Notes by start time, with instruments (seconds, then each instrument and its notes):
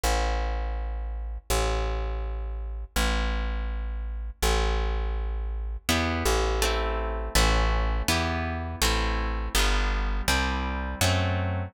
0.04 electric bass (finger) A1
1.50 electric bass (finger) A1
2.96 electric bass (finger) A1
4.42 electric bass (finger) A1
5.89 electric bass (finger) E2, acoustic guitar (steel) B3 E4 G4
6.25 electric bass (finger) A1
6.62 acoustic guitar (steel) A3 C4 E4
7.35 electric bass (finger) A1, acoustic guitar (steel) A3 C#4 F#4
8.08 electric bass (finger) E2, acoustic guitar (steel) B3 E4 G4
8.82 electric bass (finger) A1, acoustic guitar (steel) A3 C4 E4
9.55 electric bass (finger) G1, acoustic guitar (steel) G3 B3 D4
9.59 acoustic guitar (steel) F4
10.28 electric bass (finger) C2, acoustic guitar (steel) G3 C4 E4
11.01 electric bass (finger) F#2, acoustic guitar (steel) F#3 A3 C4